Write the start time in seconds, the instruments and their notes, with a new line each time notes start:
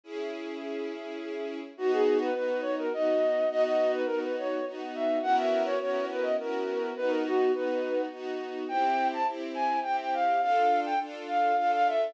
0.04 string ensemble 1 C#4 E4 G#4
1.77 string ensemble 1 B3 D#4 F#4, flute F#4
1.92 flute G#4
2.21 flute B4
2.34 string ensemble 1 B3 D#4 F#4, flute B4
2.62 flute C#5
2.79 flute A#4
2.91 string ensemble 1 B3 D#4 F#4, flute D#5
3.50 string ensemble 1 B3 D#4 F#4, flute D#5
3.64 flute D#5
3.93 flute B4
4.06 string ensemble 1 B3 D#4 F#4, flute A#4
4.22 flute B4
4.38 flute C#5
4.66 string ensemble 1 B3 D#4 F#4
4.95 flute E5
5.22 string ensemble 1 B3 C#4 E4 F#4 A#4, flute F#5
5.37 flute E5
5.65 flute C#5
5.80 string ensemble 1 B3 C#4 E4 F#4 A#4, flute C#5
6.11 flute B4
6.22 flute D#5
6.38 string ensemble 1 B3 C#4 E4 F#4 A#4, flute A#4
6.97 string ensemble 1 B3 D#4 F#4, flute B4
7.08 flute A#4
7.25 flute F#4
7.53 string ensemble 1 B3 D#4 F#4, flute B4
8.11 string ensemble 1 B3 D#4 F#4
8.68 string ensemble 1 C4 E4 G4, flute G5
9.13 flute A5
9.27 string ensemble 1 C4 E4 G4
9.55 flute G#5
9.83 string ensemble 1 C4 E4 G4, flute G5
10.01 flute G5
10.14 flute F5
10.42 string ensemble 1 D4 F4 A4, flute F5
10.86 flute G5
11.00 string ensemble 1 D4 F4 A4
11.28 flute F5
11.57 string ensemble 1 D4 F4 A4, flute F5
11.73 flute F5
11.87 flute E5